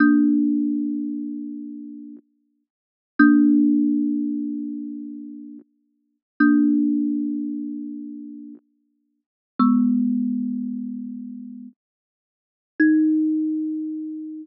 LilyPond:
\new Staff { \time 4/4 \key ees \lydian \tempo 4 = 75 <bes d'>1 | <bes d'>1 | <bes d'>1 | <aes ces'>2. r4 |
ees'1 | }